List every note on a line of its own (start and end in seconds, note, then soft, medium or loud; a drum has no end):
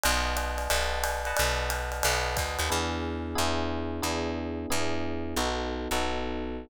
0.04 0.68 B1 loud
0.04 0.70 B4 medium
0.04 0.70 D#5 medium
0.04 0.70 F#5 medium
0.04 0.70 A5 medium
0.04 ride loud
0.37 hi-hat pedal medium
0.37 ride medium
0.58 ride medium
0.70 1.33 B1 medium
0.70 1.22 B4 medium
0.70 1.22 D#5 medium
0.70 1.22 F#5 medium
0.70 1.22 A5 medium
0.70 ride loud
1.04 hi-hat pedal medium
1.04 ride medium
1.25 2.04 B4 medium
1.25 2.04 D#5 medium
1.25 2.04 F#5 medium
1.25 2.04 A5 medium
1.25 ride medium
1.37 2.02 B1 medium
1.37 ride loud
1.70 hi-hat pedal medium
1.70 ride medium
1.92 ride medium
2.03 2.37 B1 medium
2.03 2.71 B4 medium
2.03 2.71 D#5 medium
2.03 2.71 F#5 medium
2.03 2.71 A5 medium
2.03 ride loud
2.37 2.58 D2 medium
2.37 kick medium
2.37 hi-hat pedal medium
2.37 ride medium
2.59 2.70 D#2 medium
2.59 ride medium
2.70 3.35 E2 medium
2.70 3.35 B3 loud
2.70 3.35 D4 medium
2.70 3.35 E4 medium
2.70 3.35 G#4 medium
3.35 4.01 E2 medium
3.35 4.01 B3 medium
3.35 4.01 D4 medium
3.35 4.01 E4 medium
3.35 4.01 G#4 medium
4.02 4.66 E2 medium
4.02 4.68 B3 medium
4.02 4.68 D4 loud
4.02 4.68 E4 medium
4.02 4.68 G#4 medium
4.70 5.35 E2 medium
4.70 5.36 B3 medium
4.70 5.36 D4 medium
4.70 5.36 E4 medium
4.70 5.36 G#4 medium
5.36 5.88 B1 medium
5.36 5.89 B3 medium
5.36 5.89 D#4 loud
5.36 5.89 F#4 medium
5.36 5.89 A4 medium
5.91 6.66 B1 medium
5.91 6.69 B3 loud
5.91 6.69 D#4 medium
5.91 6.69 F#4 medium
5.91 6.69 A4 medium